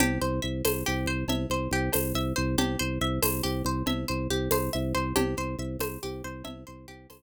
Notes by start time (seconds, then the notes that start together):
0.00 C2 G4, cowbell, low conga
0.22 C2 C5
0.42 C2 E5
0.65 C2 C5, tambourine, cowbell, high conga
0.86 C2 G4
1.06 C2 C5
1.28 C2 E5, cowbell, low conga
1.50 C2 C5
1.71 C2 G4
1.93 C2 C5, tambourine, cowbell, high conga
2.15 C2 E5
2.36 C2 C5
2.58 C2 G4, cowbell, low conga
2.79 C2 C5
3.01 C2 E5
3.22 C2 C5, tambourine, cowbell, high conga
3.43 C2 G4
3.65 C2 C5
3.86 C2 E5, cowbell, low conga
4.08 C2 C5
4.30 C2 G4
4.51 C2 C5, tambourine, cowbell, high conga
4.73 C2 E5
4.95 C2 C5
5.16 C2 G4, cowbell, low conga
5.37 C2 C5
5.59 C2 E5
5.79 C2 C5, tambourine, cowbell, high conga
6.03 C2 G4
6.24 C2 C5
6.44 C2 E5, cowbell, low conga
6.67 C2 C5
6.88 C2 G4
7.10 C2 C5, tambourine, cowbell, high conga